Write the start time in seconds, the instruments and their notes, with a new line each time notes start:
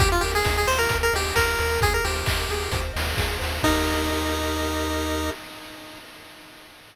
0.00 synth bass 1 D#2, lead 1 (square) G4, kick, closed hi-hat
0.12 lead 1 (square) F4
0.21 synth bass 1 D#2, lead 1 (square) G4 A#4, open hi-hat
0.35 lead 1 (square) G#4
0.45 synth bass 1 D#2, lead 1 (square) D#5, kick, snare
0.57 lead 1 (square) G#4
0.67 synth bass 1 D#2, lead 1 (square) G4 C5, open hi-hat
0.79 lead 1 (square) A#4
0.89 synth bass 1 D#2, lead 1 (square) A#4, kick, closed hi-hat
1.03 lead 1 (square) A#4
1.13 synth bass 1 D#2, lead 1 (square) G4 D#5, open hi-hat
1.36 synth bass 1 D#2, lead 1 (square) G4 A#4, kick, clap
1.59 synth bass 1 D#2, lead 1 (square) A#4, open hi-hat
1.81 synth bass 1 D#2, lead 1 (square) G#4, kick, closed hi-hat
1.94 lead 1 (square) A#4
2.05 synth bass 1 D#2, lead 1 (square) G4 C5, open hi-hat
2.26 synth bass 1 D#2, lead 1 (square) D#5, kick, clap
2.49 synth bass 1 D#2, lead 1 (square) G#4, open hi-hat
2.71 synth bass 1 D#2, lead 1 (square) C5, kick, closed hi-hat
2.94 synth bass 1 D#2, lead 1 (square) D#5, open hi-hat
3.17 synth bass 1 D#2, lead 1 (square) G#4, kick, snare
3.39 synth bass 1 D#2, lead 1 (square) C5, open hi-hat
3.63 synth bass 1 D#2, lead 1 (square) D#4 G4 A#4 D#5, kick, crash